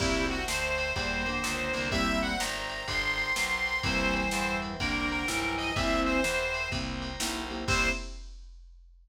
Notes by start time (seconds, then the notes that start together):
0.00 C2 A#2 G3 A#3 C4 E4 G4 A#4 C5 E5 G5, kick, crash
0.29 F#4, ride
0.48 D2 C5, snare
0.78 ride
0.95 E2 A#2 G3 A#4 C5 G5 A#5, kick, ride
1.26 D3 A#3, ride
1.44 C#2, snare
1.74 C2 D3 A#3, ride
1.91 A#2 G3 A#3 C4 E4 G4 A#4 C5 E5 G5, kick, ride
2.22 F#5, ride
2.40 G1 A#5, snare
2.69 ride
2.87 G1 A#4 C5 G5 A#5 C6, kick, ride
3.18 ride
3.36 B1, snare
3.66 ride
3.83 C2 G2 E3 A#3 C4 E4 G4 A#4 C5 E5 G5, kick, ride
4.14 C5, ride
4.31 E2 C5, snare
4.62 ride
4.79 C2 D3 A#3 A#4 C5 G5 A#5, kick, ride
5.10 A#4, ride
5.28 B1 G2 E3, snare
5.58 D#5, ride
5.75 C2 E3 A#3 C4 E4 G4 A#4 C5 E5 G5, kick, ride
6.06 C5, ride
6.24 E2, snare
6.54 ride
6.72 C2 A#3 C4 E4 G4 A#4 C5 G5 A#5, kick, ride
7.02 ride
7.20 B1 A#3 C4 E4 G4, snare
7.50 A#3 C4 E4 G4, ride
7.68 C2 A#3 C4 E4 G4 C5, kick, crash